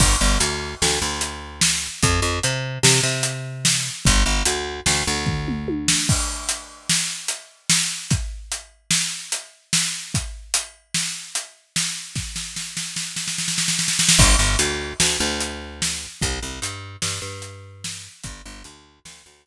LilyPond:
<<
  \new Staff \with { instrumentName = "Electric Bass (finger)" } { \clef bass \time 5/4 \key g \mixolydian \tempo 4 = 148 g,,8 g,,8 d,4 d,8 d,2~ d,8 | f,8 f,8 c4 c8 c2~ c8 | g,,8 g,,8 d,4 d,8 d,2~ d,8 | \key bes \mixolydian r1 r4 |
r1 r4 | r1 r4 | r1 r4 | \key g \mixolydian g,,8 g,,8 d,4 d,8 d,2~ d,8 |
c,8 c,8 g,4 g,8 g,2~ g,8 | g,,8 g,,8 d,4 d,8 d,2~ d,8 | }
  \new DrumStaff \with { instrumentName = "Drums" } \drummode { \time 5/4 <cymc bd>4 hh4 sn4 hh4 sn4 | <hh bd>4 hh4 sn4 hh4 sn4 | <hh bd>4 hh4 sn4 <bd tomfh>8 toml8 tommh8 sn8 | <cymc bd>4 hh4 sn4 hh4 sn4 |
<hh bd>4 hh4 sn4 hh4 sn4 | <hh bd>4 hh4 sn4 hh4 sn4 | <bd sn>8 sn8 sn8 sn8 sn8 sn16 sn16 sn16 sn16 sn16 sn16 sn16 sn16 sn16 sn16 | <cymc bd>4 hh4 sn4 hh4 sn4 |
<hh bd>4 hh4 sn4 hh4 sn4 | <hh bd>4 hh4 sn4 hh4 r4 | }
>>